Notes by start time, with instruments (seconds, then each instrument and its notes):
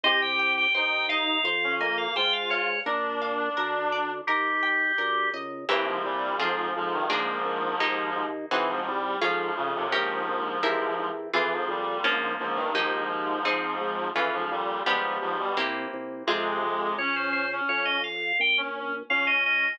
0.03 drawbar organ C2 D#5, clarinet G4, orchestral harp C5
0.22 drawbar organ G5
0.39 orchestral harp G5
0.57 drawbar organ G5
0.74 drawbar organ D#2 G5, clarinet D#4, orchestral harp C5
1.09 clarinet D#4, orchestral harp D#5, drawbar organ F5
1.44 drawbar organ F2, orchestral harp C5
1.64 clarinet C#4
1.79 clarinet A#3, drawbar organ D#5, orchestral harp G#5
1.98 drawbar organ F5
2.16 drawbar organ G#2 G5, clarinet F4, orchestral harp C5
2.33 drawbar organ F5
2.50 clarinet F4, drawbar organ C#5, orchestral harp F5
2.86 drawbar organ A#1, clarinet D4, orchestral harp A#4
3.22 orchestral harp F5
3.57 drawbar organ D2, orchestral harp A#4
3.92 orchestral harp D5
4.27 drawbar organ D#2 G4, orchestral harp A#4
4.63 orchestral harp G5
4.98 drawbar organ D2, orchestral harp A#4
5.33 drawbar organ C#2, orchestral harp D#5
5.69 drawbar organ C2, clarinet G2 E3, orchestral harp A#3 C4 E4 G4
5.86 clarinet G#2 F3
6.04 drawbar organ C2, clarinet A#2 G3
6.39 drawbar organ F2, clarinet G#2 F3, orchestral harp C4 F4 G#4
6.76 drawbar organ F2, clarinet G#2 F3
6.93 clarinet G2 D#3
7.10 drawbar organ A#1, clarinet G#2 F3, orchestral harp A#3 D4 F4 G#4
7.45 drawbar organ A#1
7.80 drawbar organ D#2, orchestral harp A#3 D#4 G4
8.16 drawbar organ D#2
8.51 drawbar organ C2, clarinet E3, orchestral harp C4 D#4 F#4 G#4
8.69 clarinet G#2 F3
8.86 drawbar organ C2, clarinet G3
9.21 drawbar organ F2, clarinet G#2 F3, orchestral harp C#4 F4 G#4
9.56 clarinet F2 C#3, drawbar organ F2
9.75 clarinet D#2 C3
9.92 drawbar organ A#1, clarinet G#2 F3, orchestral harp C#4 G4 A#4
10.28 drawbar organ A#1
10.63 drawbar organ E2, orchestral harp C4 E4 G4 A#4
10.99 drawbar organ E2
11.33 drawbar organ F2, clarinet E3, orchestral harp C4 F4 G#4
11.52 clarinet G#2 F3
11.68 drawbar organ F2, clarinet A#2 G3
12.04 drawbar organ A#1, clarinet G#2 F3, orchestral harp A#3 C#4 F4
12.39 drawbar organ A#1, clarinet G#2 F3
12.55 clarinet G2 D#3
12.74 drawbar organ D#2, clarinet G#2 F3, orchestral harp A#3 D#4 G4
13.10 drawbar organ D#2
13.45 drawbar organ G#1, orchestral harp C4 D#4 G#4
13.81 drawbar organ G#1
14.15 drawbar organ F2, clarinet E3, orchestral harp C#4 F4 G#4
14.33 clarinet G#2 F3
14.50 drawbar organ F2, clarinet A#2 G3
14.86 drawbar organ G1, clarinet G#2 F3, orchestral harp B3 D4 F4 G4
15.21 drawbar organ G1, clarinet G#2 F3
15.39 clarinet B2 G3
15.57 drawbar organ C2, orchestral harp A#3 C4 E4 G4
15.93 drawbar organ C2
16.27 drawbar organ F2, clarinet C3 G#3, orchestral harp C4 F4 G#4
16.62 drawbar organ F2
16.97 drawbar organ C#2 C#5, clarinet C#4
17.16 drawbar organ C5
17.32 drawbar organ C5
17.52 clarinet C#4
17.69 drawbar organ F2 C#5
17.85 drawbar organ D#5
18.04 drawbar organ F5
18.39 drawbar organ A#1 G5
18.57 clarinet C#4
18.76 clarinet C#4
19.09 drawbar organ C#2 F5, clarinet C#4
19.27 drawbar organ D#5
19.46 drawbar organ D#5